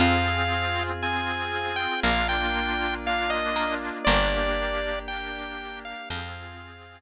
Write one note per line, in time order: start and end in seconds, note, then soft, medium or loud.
0.00 1.87 F2 medium
0.00 0.91 C4 loud
0.00 2.01 C4 medium
0.00 0.91 F4 loud
0.00 1.47 F4 medium
0.00 2.01 F4 medium
0.00 0.91 G#4 loud
0.00 2.01 G#4 medium
0.00 0.83 F5 medium
1.02 1.94 C4 loud
1.02 1.94 F4 medium
1.02 1.94 G#4 medium
1.02 1.76 G#5 medium
1.76 2.00 G5 medium
2.03 3.90 A#1 medium
2.03 4.05 A#3 medium
2.03 3.50 A#3 medium
2.03 2.95 A#3 loud
2.03 4.05 D4 medium
2.03 2.95 D4 loud
2.03 4.05 F4 medium
2.03 2.95 F4 loud
2.03 2.28 F5 medium
2.29 2.95 G5 medium
3.06 3.97 A#3 loud
3.06 3.97 D4 loud
3.06 3.97 F4 medium
3.06 3.31 F5 medium
3.30 3.75 D#5 medium
3.56 4.01 A#3 medium
4.05 5.94 G1 loud
4.05 4.99 A#3 medium
4.05 6.08 A#3 medium
4.05 4.99 A#3 loud
4.05 6.08 D4 medium
4.05 4.99 D4 loud
4.05 6.08 G4 medium
4.05 4.99 G4 loud
4.05 4.99 D5 medium
5.08 6.00 A#3 medium
5.08 6.00 D4 medium
5.08 6.00 G4 medium
5.08 5.79 G5 medium
5.85 6.09 F5 medium
6.10 7.01 F2 loud
6.10 7.01 C4 medium
6.10 7.01 C4 loud
6.10 7.01 F4 medium
6.10 7.01 F4 loud
6.10 7.01 G#4 medium
6.10 7.01 G#4 loud
6.10 6.99 F5 medium